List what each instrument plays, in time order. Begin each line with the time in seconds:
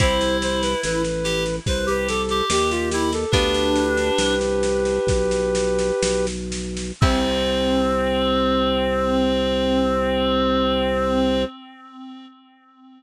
0.00 drawbar organ C2, harpsichord C4 E4 G4, clarinet E4, flute C5, kick, snare
0.21 snare
0.42 flute C5, snare
0.62 flute B4, snare
0.83 drawbar organ A1, flute B4, snare
1.04 snare
1.24 clarinet G4, snare
1.46 snare
1.66 drawbar organ C2, clarinet B4, flute C5, kick, snare
1.87 clarinet G4, flute B4, snare
2.08 flute A4, snare
2.29 clarinet G4, snare
2.50 drawbar organ D#2, flute G4, snare
2.70 flute F4, snare
2.91 clarinet E4, flute G4, snare
3.12 flute A4, snare
3.31 drawbar organ D2, harpsichord B3 D4 F4, clarinet D4, flute G4 B4, kick, snare
3.54 snare
3.76 snare
3.97 snare
4.18 drawbar organ C2, snare
4.41 snare
4.63 snare
4.85 snare
5.07 drawbar organ B1, kick, snare
5.31 snare
5.55 snare
5.79 snare
6.03 drawbar organ B1, snare
6.27 snare
6.52 snare
6.77 snare
7.01 drawbar organ C2, clarinet C4, harpsichord C4 E4 G4, flute C5, kick, crash